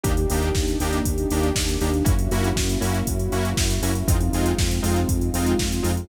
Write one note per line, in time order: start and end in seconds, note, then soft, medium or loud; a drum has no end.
0.03 0.26 D#2 loud
0.03 0.12 A#3 medium
0.03 2.03 A#3 medium
0.03 0.12 D4 medium
0.03 2.03 D4 medium
0.03 0.12 D#4 medium
0.03 2.03 D#4 loud
0.03 0.12 G4 loud
0.03 2.03 G4 medium
0.03 kick loud
0.03 closed hi-hat loud
0.17 closed hi-hat medium
0.30 0.52 D#2 medium
0.30 0.49 A#3 medium
0.30 0.49 D4 medium
0.30 0.49 D#4 medium
0.30 0.49 G4 medium
0.30 open hi-hat medium
0.42 closed hi-hat medium
0.55 0.77 D#2 medium
0.55 kick medium
0.55 snare medium
0.68 closed hi-hat medium
0.80 1.01 D#2 medium
0.80 0.99 A#3 medium
0.80 0.99 D4 medium
0.80 0.99 D#4 medium
0.80 0.99 G4 medium
0.80 open hi-hat medium
0.93 closed hi-hat medium
1.05 1.26 D#2 medium
1.05 kick medium
1.05 closed hi-hat loud
1.18 closed hi-hat medium
1.30 1.52 D#2 medium
1.30 1.49 A#3 medium
1.30 1.49 D4 medium
1.30 1.49 D#4 medium
1.30 1.49 G4 medium
1.30 open hi-hat medium
1.43 closed hi-hat medium
1.55 1.77 D#2 medium
1.55 kick medium
1.55 snare loud
1.69 closed hi-hat medium
1.81 2.03 D#2 medium
1.81 1.90 A#3 medium
1.81 1.90 D4 medium
1.81 1.90 D#4 medium
1.81 1.90 G4 medium
1.81 open hi-hat medium
1.93 closed hi-hat medium
2.04 2.28 F#2 medium
2.04 2.13 A#3 medium
2.04 4.04 A#3 medium
2.04 2.13 C#4 medium
2.04 4.04 C#4 medium
2.04 2.13 E4 medium
2.04 4.04 E4 medium
2.04 2.13 F#4 medium
2.04 4.04 F#4 medium
2.04 kick loud
2.04 closed hi-hat loud
2.19 closed hi-hat medium
2.31 2.53 F#2 medium
2.31 2.49 A#3 medium
2.31 2.49 C#4 medium
2.31 2.49 E4 medium
2.31 2.49 F#4 medium
2.31 open hi-hat medium
2.44 closed hi-hat medium
2.56 2.77 F#2 medium
2.56 kick medium
2.56 snare loud
2.69 closed hi-hat medium
2.81 3.03 F#2 medium
2.81 2.98 A#3 medium
2.81 2.98 C#4 medium
2.81 2.98 E4 medium
2.81 2.98 F#4 medium
2.81 open hi-hat medium
2.94 closed hi-hat medium
3.07 3.29 F#2 medium
3.07 kick medium
3.07 closed hi-hat loud
3.19 closed hi-hat medium
3.32 3.54 F#2 medium
3.32 3.50 A#3 medium
3.32 3.50 C#4 medium
3.32 3.50 E4 medium
3.32 3.50 F#4 medium
3.32 open hi-hat medium
3.45 closed hi-hat medium
3.57 3.79 F#2 medium
3.57 kick loud
3.57 snare loud
3.70 closed hi-hat medium
3.82 4.03 F#2 medium
3.82 3.91 A#3 medium
3.82 3.91 C#4 medium
3.82 3.91 E4 medium
3.82 3.91 F#4 medium
3.82 open hi-hat medium
3.95 closed hi-hat medium
4.07 4.29 F2 loud
4.07 6.06 G#3 medium
4.07 4.16 G#3 medium
4.07 6.06 C4 medium
4.07 4.16 C4 medium
4.07 6.06 D#4 medium
4.07 4.16 D#4 medium
4.07 6.06 F4 medium
4.07 4.16 F4 medium
4.07 kick loud
4.07 closed hi-hat loud
4.20 closed hi-hat medium
4.33 4.54 F2 medium
4.33 4.52 G#3 medium
4.33 4.52 C4 medium
4.33 4.52 D#4 medium
4.33 4.52 F4 medium
4.33 open hi-hat medium
4.46 closed hi-hat medium
4.58 4.80 F2 medium
4.58 kick loud
4.58 snare loud
4.71 closed hi-hat medium
4.82 5.05 F2 medium
4.82 5.00 G#3 medium
4.82 5.00 C4 medium
4.82 5.00 D#4 medium
4.82 5.00 F4 medium
4.82 open hi-hat medium
4.96 closed hi-hat medium
5.09 5.31 F2 medium
5.09 kick medium
5.09 closed hi-hat loud
5.21 closed hi-hat medium
5.33 5.55 F2 medium
5.33 5.52 G#3 medium
5.33 5.52 C4 medium
5.33 5.52 D#4 medium
5.33 5.52 F4 medium
5.33 open hi-hat medium
5.46 closed hi-hat medium
5.59 5.81 F2 medium
5.59 kick medium
5.59 snare loud
5.72 closed hi-hat medium
5.83 6.05 F2 medium
5.83 5.91 G#3 medium
5.83 5.91 C4 medium
5.83 5.91 D#4 medium
5.83 5.91 F4 medium
5.83 open hi-hat medium
5.97 closed hi-hat medium